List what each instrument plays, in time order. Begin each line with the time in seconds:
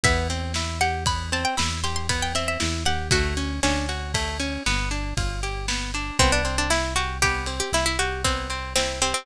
0.04 synth bass 1 E2, acoustic guitar (steel) B3, pizzicato strings E5, kick, ride
0.30 acoustic guitar (steel) C4, ride
0.54 acoustic guitar (steel) E4, snare
0.81 acoustic guitar (steel) G4, pizzicato strings F#5, ride
1.06 acoustic guitar (steel) B3, pizzicato strings B5, kick, ride
1.32 acoustic guitar (steel) C4, pizzicato strings A5, ride
1.45 pizzicato strings G5
1.57 synth bass 1 E2, acoustic guitar (steel) E4, pizzicato strings B5, snare
1.84 acoustic guitar (steel) G4, pizzicato strings C6, ride
1.96 pizzicato strings C6
2.09 acoustic guitar (steel) B3, pizzicato strings B5, kick, ride
2.22 pizzicato strings G5
2.35 acoustic guitar (steel) C4, pizzicato strings E5, ride
2.48 pizzicato strings E5
2.60 synth bass 1 E2, acoustic guitar (steel) E4, snare
2.85 synth bass 1 D#2, acoustic guitar (steel) G4, pizzicato strings F#5, ride
3.11 synth bass 1 D2, acoustic guitar (steel) A3, pizzicato strings F#4, kick, ride
3.37 acoustic guitar (steel) C#4, ride
3.63 synth bass 1 D2, pizzicato strings C#4, acoustic guitar (steel) D4, snare
3.89 acoustic guitar (steel) F#4, ride
4.14 acoustic guitar (steel) A3, kick, ride
4.40 acoustic guitar (steel) C#4, ride
4.66 synth bass 1 G1, acoustic guitar (steel) B3, snare
4.91 acoustic guitar (steel) D4, ride
5.17 synth bass 1 G1, acoustic guitar (steel) F4, kick, ride
5.43 acoustic guitar (steel) G4, ride
5.68 acoustic guitar (steel) B3, snare
5.94 acoustic guitar (steel) D4, ride
6.19 synth bass 1 C2, acoustic guitar (steel) B3, pizzicato strings C4, kick, ride
6.32 pizzicato strings D4
6.45 acoustic guitar (steel) C4, ride
6.58 pizzicato strings D4
6.70 acoustic guitar (steel) E4, pizzicato strings E4, snare
6.96 pizzicato strings F#4, acoustic guitar (steel) G4, ride
7.22 acoustic guitar (steel) B3, pizzicato strings G4, kick, ride
7.46 acoustic guitar (steel) C4, ride
7.60 pizzicato strings G4
7.72 synth bass 1 C2, acoustic guitar (steel) E4, pizzicato strings E4, snare
7.86 pizzicato strings E4
7.99 pizzicato strings F#4, acoustic guitar (steel) G4, ride
8.24 acoustic guitar (steel) B3, pizzicato strings C4, kick, ride
8.50 acoustic guitar (steel) C4, ride
8.76 pizzicato strings C4, acoustic guitar (steel) E4, snare
9.02 pizzicato strings C4, acoustic guitar (steel) G4, ride
9.14 pizzicato strings C4